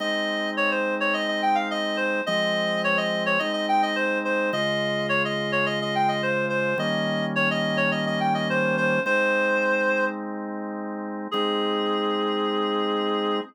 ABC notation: X:1
M:4/4
L:1/16
Q:1/4=106
K:Ab
V:1 name="Clarinet"
e4 d c2 d e e g f e2 c2 | e4 d e2 d e e g e c2 c2 | e4 d e2 d e e g e c2 c2 | e4 d e2 d e e g e c2 c2 |
c8 z8 | A16 |]
V:2 name="Drawbar Organ"
[A,CE]16 | [F,A,C]8 [A,CE]8 | [D,A,F]16 | [E,G,B,D]16 |
[A,CE]16 | [A,CE]16 |]